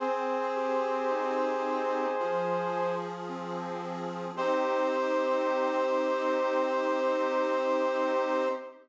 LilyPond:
<<
  \new Staff \with { instrumentName = "Brass Section" } { \time 4/4 \key c \minor \tempo 4 = 55 <aes' c''>2. r4 | c''1 | }
  \new Staff \with { instrumentName = "Accordion" } { \time 4/4 \key c \minor c'8 g'8 ees'8 g'8 f8 aes'8 c'8 aes'8 | <c' ees' g'>1 | }
>>